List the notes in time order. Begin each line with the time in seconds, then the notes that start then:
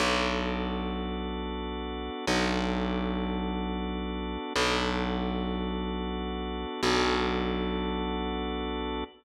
0.00 B1 B3 D4 F#4 A4
2.27 B1 B3 D4 F#4 A4
4.56 B1 B3 D4 F#4 A4
6.83 B1 B3 D4 F#4 A4